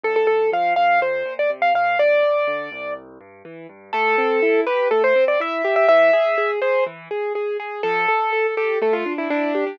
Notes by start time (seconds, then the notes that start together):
0.03 D2 A4
0.16 A4
0.27 A2 A4
0.52 F3 F5
0.76 A2 F5
1.01 F2 C5
1.25 A#2
1.39 D5
1.50 C3
1.62 F5
1.74 A#2 F5
1.99 A#1 D5
2.23 F2
2.47 D3
2.72 C2
3.21 G2
3.45 E3
3.69 G2
3.93 A3 A4
4.18 C4
4.42 E4
4.67 G4 B4
4.91 A3 A4
5.04 C5
5.16 C4
5.28 D5
5.40 E4 E5
5.64 G4
5.76 E5
5.88 E3 E5
6.13 G#4
6.38 G#4
6.62 G#4 C5
6.86 E3
7.11 G#4
7.35 G#4
7.60 G#4
7.83 F3 A4
8.08 A4
8.33 A4
8.57 G4 A4
8.82 A3 A4
8.93 F4
9.06 D4
9.18 E4
9.30 D4 E4
9.55 G4
9.67 D4